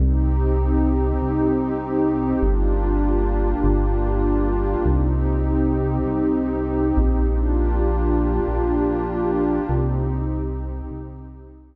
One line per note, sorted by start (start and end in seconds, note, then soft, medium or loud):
0.00 1.13 C2 loud
0.00 2.40 C4 medium
0.00 2.40 D#4 medium
0.00 2.40 G4 medium
1.21 2.34 C2 medium
2.42 3.55 G1 medium
2.42 4.83 A#3 medium
2.42 4.83 D4 medium
2.42 4.83 F4 medium
2.42 4.83 G4 medium
3.64 4.76 G1 loud
4.84 5.98 C2 loud
4.84 7.24 C4 medium
4.84 7.24 D#4 medium
4.84 7.24 G4 medium
6.06 6.93 C2 medium
6.97 8.40 A#1 medium
7.27 9.68 A#3 medium
7.27 9.68 D4 medium
7.27 9.68 F4 medium
7.27 9.68 G4 medium
8.48 9.60 A#1 medium
9.69 10.82 C2 loud
9.69 11.76 C4 medium
9.69 11.76 D#4 medium
9.69 11.76 G4 medium
10.91 11.76 C2 loud